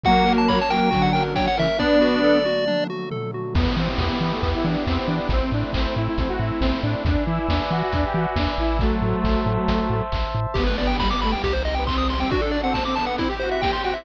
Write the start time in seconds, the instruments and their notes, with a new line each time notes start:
0.04 pad 2 (warm) F#3 A#3 C#4, lead 1 (square) F#3 A#3 F#4 F#5, kick, closed hi-hat
0.16 closed hi-hat
0.26 lead 1 (square) A#4, open hi-hat
0.37 lead 1 (square) A5, closed hi-hat
0.48 lead 1 (square) C#5 B5, kick, clap
0.59 lead 1 (square) A5, closed hi-hat
0.70 lead 1 (square) F#3 A#3 A#4 G5, open hi-hat
0.81 closed hi-hat
0.91 lead 1 (square) D3 F#3 F#4, kick, closed hi-hat
1.02 lead 1 (square) F#5, closed hi-hat
1.13 lead 1 (square) A#4 G5, open hi-hat
1.26 closed hi-hat
1.36 lead 1 (square) C#5 G5, kick, snare
1.48 lead 1 (square) F#5, closed hi-hat
1.57 lead 1 (square) C#3 E3 A#4 E5, open hi-hat
1.67 closed hi-hat
1.78 pad 2 (warm) D3 F#3 A3, lead 1 (square) B3 D4 D5, kick, snare
2.01 lead 1 (square) F#4, snare
2.24 lead 1 (square) A4
2.45 lead 1 (square) F#4, high tom
2.68 lead 1 (square) D4, mid tom
2.90 lead 1 (square) F#4
3.11 lead 1 (square) A4, floor tom
3.34 lead 1 (square) F#4
3.54 synth bass 1 E2, lead 1 (square) B3, pad 2 (warm) B3 E4 G4, kick, crash
3.77 synth bass 1 E3, lead 1 (square) C4
3.97 synth bass 1 E2, lead 1 (square) B3, kick, snare
4.21 synth bass 1 E3, lead 1 (square) B3
4.31 lead 1 (square) A3
4.41 synth bass 1 E2, lead 1 (square) B3, kick, closed hi-hat
4.55 lead 1 (square) E4
4.64 synth bass 1 E3, lead 1 (square) D4
4.86 synth bass 1 E2, lead 1 (square) C4, kick, clap
5.06 synth bass 1 E3, lead 1 (square) D4
5.29 synth bass 1 A1, pad 2 (warm) A3 C4 E4, lead 1 (square) C4, kick, closed hi-hat
5.52 synth bass 1 A2, lead 1 (square) D4
5.73 synth bass 1 A1, lead 1 (square) C4, kick, clap
5.96 synth bass 1 A2, lead 1 (square) E4
6.07 lead 1 (square) E4
6.18 synth bass 1 A1, lead 1 (square) C4, kick, closed hi-hat
6.28 lead 1 (square) F#4
6.40 synth bass 1 A2, lead 1 (square) E4
6.60 synth bass 1 A1, lead 1 (square) C4, kick, snare
6.82 synth bass 1 A2, lead 1 (square) D4
7.05 synth bass 1 E2, lead 1 (square) D4, pad 2 (warm) B4 D5 E5 G#5, kick, closed hi-hat
7.26 synth bass 1 E3, lead 1 (square) E4
7.49 synth bass 1 E2, lead 1 (square) D4, kick, snare
7.70 synth bass 1 E3, lead 1 (square) F#4
7.82 lead 1 (square) F#4
7.92 synth bass 1 E2, lead 1 (square) D4, kick, closed hi-hat
8.05 lead 1 (square) G4
8.14 synth bass 1 E3, lead 1 (square) F#4
8.36 synth bass 1 E2, lead 1 (square) D4, kick, snare
8.58 synth bass 1 A1, lead 1 (square) E4
8.79 lead 1 (square) F#3 A3, pad 2 (warm) C5 E5 A5, kick, closed hi-hat
9.02 synth bass 1 A2
9.24 synth bass 1 A1, kick, clap
9.46 synth bass 1 A2
9.68 synth bass 1 A1, kick, closed hi-hat
9.90 synth bass 1 A2
10.12 synth bass 1 A1, kick, clap
10.35 synth bass 1 A2
10.54 synth bass 1 G1, pad 2 (warm) B3 D4 G4, lead 1 (square) B3 G4, kick, crash
10.65 lead 1 (square) A3 B4, closed hi-hat
10.78 lead 1 (square) B3 D5, open hi-hat
10.87 lead 1 (square) G5, closed hi-hat
10.99 pad 2 (warm) G3 B3 G4, lead 1 (square) G3 B5, kick, snare
11.11 lead 1 (square) B3 D6, closed hi-hat
11.22 lead 1 (square) A3 B5, open hi-hat
11.32 lead 1 (square) G5, closed hi-hat
11.44 synth bass 1 C2, pad 2 (warm) C4 D#4 G4, lead 1 (square) G4, kick, closed hi-hat
11.53 lead 1 (square) C5, closed hi-hat
11.65 lead 1 (square) D#5, open hi-hat
11.75 lead 1 (square) B3 G5, closed hi-hat
11.87 pad 2 (warm) G3 C4 G4, lead 1 (square) C4 C6, kick, clap
11.98 lead 1 (square) D#6, closed hi-hat
12.09 lead 1 (square) C6, open hi-hat
12.18 lead 1 (square) C4 G5, open hi-hat
12.30 lead 1 (square) D4 F#4, pad 2 (warm) D4 F#4 A4, kick, closed hi-hat
12.42 lead 1 (square) A4, closed hi-hat
12.51 lead 1 (square) D5, open hi-hat
12.62 lead 1 (square) C4 F#5, closed hi-hat
12.74 pad 2 (warm) D4 A4 D5, lead 1 (square) A5, kick, snare
12.85 lead 1 (square) C4 D6, closed hi-hat
12.96 lead 1 (square) B3 A5, open hi-hat
13.06 lead 1 (square) F#5, closed hi-hat
13.18 pad 2 (warm) C4 E4 G4, lead 1 (square) C4 E4, kick, closed hi-hat
13.29 lead 1 (square) G4, closed hi-hat
13.40 lead 1 (square) F#4 C5, open hi-hat
13.51 lead 1 (square) E5, closed hi-hat
13.62 pad 2 (warm) C4 G4 C5, lead 1 (square) G4 G5, kick, snare
13.73 lead 1 (square) C6, closed hi-hat
13.83 lead 1 (square) F#4 G5, open hi-hat
13.94 lead 1 (square) E4 E5, closed hi-hat